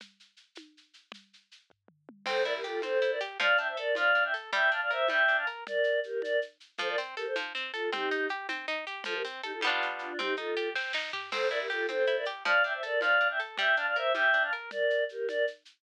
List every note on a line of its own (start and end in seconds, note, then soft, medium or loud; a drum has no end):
0.00 low conga medium
0.00 shaker medium
0.20 shaker medium
0.37 shaker medium
0.55 high conga medium
0.55 shaker medium
0.77 shaker medium
0.94 shaker medium
1.12 low conga medium
1.12 shaker medium
1.33 shaker medium
1.51 shaker medium
1.70 kick medium
1.70 floor tom medium
1.88 mid tom medium
2.09 high tom medium
2.26 2.43 C4 medium
2.26 2.43 A4 medium
2.26 2.43 C5 medium
2.26 crash loud
2.26 low conga loud
2.26 shaker medium
2.44 2.62 E4 medium
2.44 2.53 A#4 medium
2.44 2.53 D5 medium
2.44 shaker medium
2.55 2.64 G4 medium
2.55 2.64 A#4 medium
2.64 2.81 F4 medium
2.64 2.81 G4 medium
2.64 2.81 A4 medium
2.64 shaker medium
2.82 3.00 C4 medium
2.82 3.11 A4 medium
2.82 3.11 C5 medium
2.82 high conga medium
2.82 shaker medium
3.02 3.19 E4 medium
3.02 shaker medium
3.11 3.20 A#4 medium
3.11 3.20 D5 medium
3.21 3.38 G4 medium
3.21 shaker medium
3.40 3.57 F3 medium
3.40 3.57 D5 medium
3.40 3.57 F5 medium
3.40 low conga loud
3.40 shaker medium
3.57 3.75 D4 medium
3.57 3.67 E5 medium
3.57 3.67 G5 medium
3.57 shaker medium
3.68 3.77 C5 medium
3.68 3.77 E5 medium
3.77 3.94 A4 medium
3.77 3.95 A#4 medium
3.77 3.95 D5 medium
3.77 shaker medium
3.95 4.13 F3 medium
3.95 4.24 D5 medium
3.95 4.24 F5 medium
3.95 high conga medium
3.95 shaker medium
4.15 4.32 D4 medium
4.15 shaker medium
4.25 4.34 E5 medium
4.25 4.34 G5 medium
4.34 4.51 A4 medium
4.34 shaker medium
4.53 4.70 G3 medium
4.53 4.71 E5 medium
4.53 4.71 G5 medium
4.53 low conga medium
4.53 shaker medium
4.71 4.89 D4 medium
4.71 4.80 F5 medium
4.71 4.80 A5 medium
4.71 shaker medium
4.82 4.91 D5 medium
4.82 4.91 F5 medium
4.91 5.08 A#4 medium
4.91 5.08 C5 medium
4.91 5.08 E5 medium
4.91 shaker medium
5.08 5.26 G3 medium
5.08 5.37 E5 medium
5.08 5.37 G5 medium
5.08 high conga medium
5.08 shaker medium
5.28 5.45 D4 medium
5.28 shaker medium
5.37 5.46 F5 medium
5.37 5.46 A5 medium
5.47 5.64 A#4 medium
5.47 shaker medium
5.67 6.00 A#4 medium
5.67 6.00 D5 medium
5.67 low conga medium
5.67 shaker medium
5.84 shaker medium
6.03 6.21 G4 medium
6.03 6.21 A#4 medium
6.03 shaker medium
6.22 6.40 A#4 medium
6.22 6.40 D5 medium
6.22 high conga medium
6.22 shaker medium
6.42 shaker medium
6.60 shaker medium
6.78 6.96 F3 medium
6.78 6.88 A4 medium
6.78 6.88 C5 medium
6.78 low conga medium
6.78 shaker medium
6.89 6.98 A#4 medium
6.89 6.98 D5 medium
6.98 7.15 C4 medium
6.98 shaker medium
7.17 7.26 G4 medium
7.17 7.34 A4 medium
7.17 7.26 A#4 medium
7.17 shaker medium
7.26 7.35 A4 medium
7.26 7.35 C5 medium
7.36 7.53 F3 medium
7.36 high conga medium
7.36 shaker medium
7.55 7.72 C4 medium
7.55 shaker medium
7.73 7.90 F4 medium
7.73 7.90 A4 medium
7.73 7.91 A4 medium
7.73 shaker medium
7.92 8.09 C4 medium
7.92 8.27 D#4 medium
7.92 8.27 G4 medium
7.92 low conga loud
7.92 shaker medium
8.11 8.28 D#4 medium
8.11 shaker medium
8.29 8.47 G4 medium
8.29 shaker medium
8.49 8.66 C4 medium
8.49 high conga medium
8.49 shaker medium
8.68 8.85 D#4 medium
8.68 shaker medium
8.87 9.04 G4 medium
8.87 shaker medium
9.04 9.23 F3 medium
9.04 9.14 F4 medium
9.04 9.14 A4 medium
9.04 low conga loud
9.04 shaker medium
9.14 9.23 G4 medium
9.14 9.23 A#4 medium
9.25 9.42 C4 medium
9.25 shaker medium
9.43 9.52 D#4 medium
9.43 9.52 G4 medium
9.43 9.60 A4 medium
9.43 shaker medium
9.53 9.62 F4 medium
9.53 9.62 A4 medium
9.61 10.13 G3 medium
9.61 10.13 B3 medium
9.61 high conga medium
9.61 shaker medium
9.67 10.13 D4 medium
9.67 10.13 F4 medium
9.82 shaker medium
9.99 10.19 D4 medium
9.99 10.19 F4 medium
9.99 shaker medium
10.19 10.36 C4 medium
10.19 10.34 D#4 medium
10.19 10.34 G4 medium
10.19 low conga loud
10.19 shaker medium
10.36 10.55 D#4 medium
10.36 10.69 F4 medium
10.36 10.69 A4 medium
10.36 shaker medium
10.57 10.74 G4 medium
10.57 shaker medium
10.75 10.92 C4 medium
10.75 kick medium
10.75 snare medium
10.93 11.11 D#4 medium
10.93 snare medium
11.13 11.30 G4 medium
11.13 floor tom loud
11.31 11.49 C4 medium
11.31 11.48 A4 medium
11.31 11.48 C5 medium
11.31 crash loud
11.31 low conga loud
11.31 shaker medium
11.50 11.68 E4 medium
11.50 11.59 A#4 medium
11.50 11.59 D5 medium
11.50 shaker medium
11.60 11.69 G4 medium
11.60 11.69 A#4 medium
11.70 11.87 F4 medium
11.70 11.87 G4 medium
11.70 11.87 A4 medium
11.70 shaker medium
11.89 12.06 C4 medium
11.89 12.16 A4 medium
11.89 12.16 C5 medium
11.89 high conga medium
11.89 shaker medium
12.07 12.25 E4 medium
12.07 shaker medium
12.17 12.26 A#4 medium
12.17 12.26 D5 medium
12.25 12.43 G4 medium
12.25 shaker medium
12.45 12.62 F3 medium
12.45 12.63 D5 medium
12.45 12.63 F5 medium
12.45 low conga loud
12.45 shaker medium
12.64 12.81 D4 medium
12.64 12.73 E5 medium
12.64 12.73 G5 medium
12.64 shaker medium
12.74 12.83 C5 medium
12.74 12.83 E5 medium
12.83 13.00 A4 medium
12.83 13.02 A#4 medium
12.83 13.00 D5 medium
12.83 shaker medium
13.01 13.19 F3 medium
13.01 13.28 D5 medium
13.01 13.28 F5 medium
13.01 high conga medium
13.01 shaker medium
13.20 13.38 D4 medium
13.20 shaker medium
13.30 13.39 E5 medium
13.30 13.39 G5 medium
13.39 13.57 A4 medium
13.39 shaker medium
13.58 13.75 G3 medium
13.58 13.76 E5 medium
13.58 13.76 G5 medium
13.58 low conga medium
13.58 shaker medium
13.76 13.94 D4 medium
13.76 13.86 F5 medium
13.76 13.86 A5 medium
13.76 shaker medium
13.87 13.96 D5 medium
13.87 13.96 F5 medium
13.95 14.13 A#4 medium
13.95 14.13 C5 medium
13.95 14.13 E5 medium
13.95 shaker medium
14.14 14.32 G3 medium
14.14 14.43 E5 medium
14.14 14.43 G5 medium
14.14 high conga medium
14.14 shaker medium
14.33 14.51 D4 medium
14.33 shaker medium
14.44 14.53 F5 medium
14.44 14.53 A5 medium
14.52 14.70 A#4 medium
14.52 shaker medium
14.71 15.04 A#4 medium
14.71 15.04 D5 medium
14.71 low conga medium
14.71 shaker medium
14.90 shaker medium
15.09 15.27 G4 medium
15.09 15.27 A#4 medium
15.09 shaker medium
15.28 15.45 A#4 medium
15.28 15.45 D5 medium
15.28 high conga medium
15.28 shaker medium
15.47 shaker medium
15.65 shaker medium